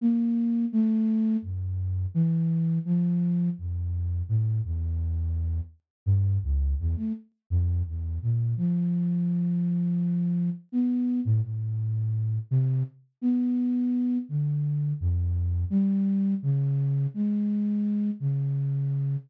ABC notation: X:1
M:6/8
L:1/16
Q:3/8=56
K:none
V:1 name="Flute"
^A,4 =A,4 ^F,,4 | E,4 F,4 F,,4 | A,,2 E,,6 z2 G,,2 | ^C,,2 E,, A, z2 F,,2 E,,2 ^A,,2 |
F,12 | B,3 A,, A,,6 C,2 | z2 B,6 D,4 | F,,4 G,4 ^C,4 |
^G,6 ^C,6 |]